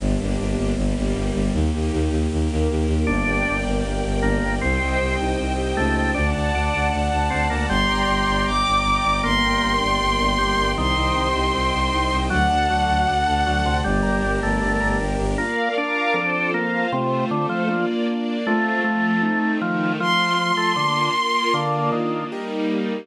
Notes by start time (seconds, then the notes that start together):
0.00 G1 A#3 D4 G4
0.20 G1
0.39 G1
0.57 G1
0.76 G1 G3 A#3 G4
0.98 G1
1.14 G1
1.34 G1
1.53 D#2 A#3 D#4 G4
1.73 D#2
1.92 D#2
2.10 D#2
2.31 D#2 A#3 G4 A#4
2.51 D#2
2.70 D#2
2.88 D#2
3.07 G1 A#3 D4 A#4 D5 G5
3.26 G1 G4
3.47 G1 A#3
3.64 G1 D4
3.84 G1 A#3
4.05 G1 G4
4.22 G1 A#3 D4
4.42 G1 A#3
4.61 C2 C4 C5 D#5 G5
4.80 C2 G4
4.99 C2 C4
5.19 C2 D#4
5.39 C2 C4
5.58 G4
5.76 C#2 A3 D#4
5.96 C4
6.14 D2 D4 D5 F#5 A5
6.34 D2 A5
6.52 D2 D4 D5
6.72 D2 F#5
6.92 D2 D5
7.12 D2 A5
7.30 D2 C4 F#5
7.50 D2 A#3 D5
7.68 G1 G3 D5 G5 A#5 C6
7.89 G1 A#5
8.08 G1 D5
8.27 G1 G5
8.46 G1 D5 D6
8.66 G1 A#5
8.83 G1 G5
9.04 G1 D5
9.23 G1 A#3 A#4 D5 G5 C6
9.42 G1 G4
9.61 G1 A#3
9.80 G1 D4
10.00 G1 A#3
10.19 G1 G4
10.38 G1 G3 D4
10.57 G1 A#3
10.77 C2 D#3 C4 C5 D#5 G5 C6
10.96 C2 G4
11.15 C2 C4
11.34 C2 D#4
11.54 C2 C4
11.73 C2 G4
11.93 C2 D#4
12.11 C2 C4
12.30 D2 F#3 D4 F#4 A4 D5 F#5
12.50 D2 A5
12.69 D2 F#3 D5
12.88 D2 F#5
13.07 D2 D5
13.27 D2 A5
13.45 D2 F#3 F#5
13.65 D2 C3 D5
13.84 G1 G3 D4 G4 A#4 D5
14.03 G1 A#5
14.22 G1 D5
14.43 G1 A3 G5
14.61 G1 D5
14.80 G1 A#5
15.00 G1 G5
15.19 G1 D5
15.38 A#3 D4 F4 A#4 D5 F5
15.76 D4 A#4 F5 A#5
16.14 F3 C4 F4 A4 C5
16.53 A#3 F4 C5 F5
16.92 C3 A3 C4 F4 C5
17.31 D3 A3 A4 C5
17.49 F3
17.68 A#3 D4 F4 D5
18.08 A#3 D4 D5
18.45 A3 C4 F4
18.84 F3 A3 F4
19.22 A3 C4 D#4
19.60 D#3 F3 A3 D#4
20.00 F3 A3 C4 F4 C6
20.38 F3 A3 F4
20.57 A3
20.76 D3 A#3 D4 F4
21.15 A#3 F4 A#4
21.54 D3 A#3 D4 F4 A#4 D5 F5
21.92 D#3
22.31 G3 A#3 D#4 G4 A#4 D#5